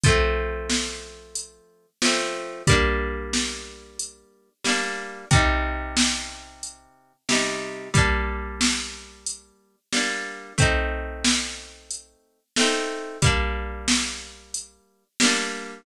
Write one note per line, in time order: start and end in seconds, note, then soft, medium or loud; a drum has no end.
0.04 1.86 F3 medium
0.04 1.86 A3 medium
0.04 kick loud
0.04 closed hi-hat medium
0.08 1.86 C4 medium
0.70 snare medium
1.35 closed hi-hat medium
2.02 2.63 F3 medium
2.02 2.63 A3 medium
2.02 snare loud
2.06 2.63 C4 medium
2.67 4.49 G3 medium
2.67 4.49 A#3 medium
2.67 kick medium
2.67 closed hi-hat loud
2.72 4.49 D4 medium
3.33 snare medium
3.99 closed hi-hat medium
4.64 5.25 G3 medium
4.64 5.25 A#3 medium
4.64 snare medium
4.69 5.25 D4 medium
5.31 7.13 C3 medium
5.31 7.13 G3 medium
5.31 kick loud
5.31 closed hi-hat medium
5.35 7.13 D#4 medium
5.97 snare loud
6.63 closed hi-hat medium
7.29 7.89 C3 medium
7.29 7.89 G3 medium
7.29 7.89 D#4 medium
7.29 snare loud
7.94 9.76 G3 medium
7.94 9.76 A#3 medium
7.94 kick medium
7.94 closed hi-hat medium
7.98 9.76 D4 medium
8.61 snare loud
9.27 closed hi-hat medium
9.92 10.53 G3 medium
9.92 10.53 A#3 medium
9.92 snare medium
9.97 10.53 D4 medium
10.58 12.40 A3 medium
10.58 12.40 C4 medium
10.58 kick medium
10.58 closed hi-hat medium
10.62 12.40 D#4 medium
11.24 snare loud
11.91 closed hi-hat medium
12.56 13.18 A3 medium
12.56 13.18 C4 medium
12.56 snare loud
12.61 13.18 D#4 medium
13.22 15.04 G3 medium
13.22 15.04 A#3 medium
13.22 kick medium
13.22 closed hi-hat loud
13.26 15.04 D4 medium
13.88 snare loud
14.54 closed hi-hat medium
15.20 15.81 G3 medium
15.20 15.81 A#3 medium
15.20 snare loud
15.25 15.81 D4 medium